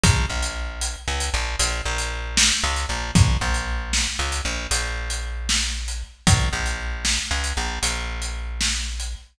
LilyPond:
<<
  \new Staff \with { instrumentName = "Electric Bass (finger)" } { \clef bass \time 12/8 \key bes \lydian \tempo 4. = 77 bes,,8 bes,,4. des,8 bes,,8 bes,,8 bes,,4. des,8 bes,,8 | bes,,8 bes,,4. des,8 bes,,8 bes,,2. | bes,,8 bes,,4. des,8 bes,,8 bes,,2. | }
  \new DrumStaff \with { instrumentName = "Drums" } \drummode { \time 12/8 <hh bd>8. hh8. hh8. hh8. hh8. hh8. sn8. hh8. | <hh bd>8. hh8. sn8. hh8. hh8. hh8. sn8. hh8. | <hh bd>8. hh8. sn8. hh8. hh8. hh8. sn8. hh8. | }
>>